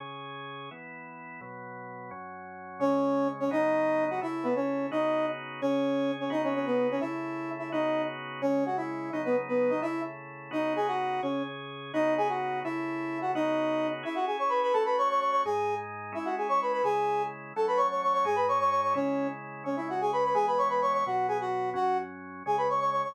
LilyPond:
<<
  \new Staff \with { instrumentName = "Brass Section" } { \time 6/8 \key cis \minor \tempo 4. = 171 r2. | r2. | r2. | r2. |
<cis' cis''>2~ <cis' cis''>8 <cis' cis''>8 | <dis' dis''>2~ <dis' dis''>8 <fis' fis''>8 | <e' e''>4 <b b'>8 <cis' cis''>4. | <dis' dis''>4. r4. |
<cis' cis''>2~ <cis' cis''>8 <cis' cis''>8 | <dis' dis''>8 <cis' cis''>8 <cis' cis''>8 <b b'>4 <cis' cis''>8 | <e' e''>2~ <e' e''>8 <e' e''>8 | <dis' dis''>4. r4. |
<cis' cis''>4 <fis' fis''>8 <e' e''>4. | <dis' dis''>8 <b b'>8 r8 <b b'>4 <dis' dis''>8 | <e' e''>4 r2 | <dis' dis''>4 <gis' gis''>8 <fis' fis''>4. |
<cis' cis''>4 r2 | <dis' dis''>4 <gis' gis''>8 <fis' fis''>4. | <e' e''>2~ <e' e''>8 <fis' fis''>8 | <dis' dis''>2~ <dis' dis''>8 r8 |
<e' e''>8 <fis' fis''>8 <gis' gis''>8 <cis'' cis'''>8 <b' b''>8 <b' b''>8 | <a' a''>8 <b' b''>8 <cis'' cis'''>8 <cis'' cis'''>8 <cis'' cis'''>8 <cis'' cis'''>8 | <gis' gis''>4. r4. | <e' e''>8 <fis' fis''>8 <gis' gis''>8 <cis'' cis'''>8 <b' b''>8 <b' b''>8 |
<gis' gis''>2 r4 | <a' a''>8 <b' b''>8 <cis'' cis'''>8 <cis'' cis'''>8 <cis'' cis'''>8 <cis'' cis'''>8 | <gis' gis''>8 <b' b''>8 <cis'' cis'''>8 <cis'' cis'''>8 <cis'' cis'''>8 <cis'' cis'''>8 | <cis' cis''>4. r4. |
<cis' cis''>8 <e' e''>8 <fis' fis''>8 <gis' gis''>8 <b' b''>8 <b' b''>8 | <gis' gis''>8 <b' b''>8 <cis'' cis'''>8 <b' b''>8 <cis'' cis'''>8 <cis'' cis'''>8 | <fis' fis''>4 <gis' gis''>8 <fis' fis''>4. | <fis' fis''>4 r2 |
<gis' gis''>8 <b' b''>8 <cis'' cis'''>8 <cis'' cis'''>8 <cis'' cis'''>8 <cis'' cis'''>8 | }
  \new Staff \with { instrumentName = "Drawbar Organ" } { \time 6/8 \key cis \minor <cis cis' gis'>2. | <e b e'>2. | <b, fis b>2. | <fis, fis cis'>2. |
<cis gis cis'>2. | <cis fis b dis'>2. | <cis a e'>2. | <cis b dis' fis'>2. |
<cis cis' gis'>2. | <cis b dis' fis'>2. | <cis a e'>2. | <cis b dis' fis'>2. |
<cis gis cis'>2. | <cis fis b dis'>2. | <cis a e'>2. | <cis b dis' fis'>2. |
<cis cis' gis'>2. | <cis b dis' fis'>2. | <cis a e'>2. | <cis b dis' fis'>2. |
<cis' e' gis'>2. | <a cis' fis'>2. | <gis, gis dis'>2. | <gis cis' e'>2. |
<cis gis e'>2. | <fis a cis'>2. | <gis, gis dis'>2. | <cis gis e'>2. |
<cis gis cis'>2. | <e gis b>2. | <b, fis b>2. | <fis, fis cis'>2. |
<cis gis cis'>2. | }
>>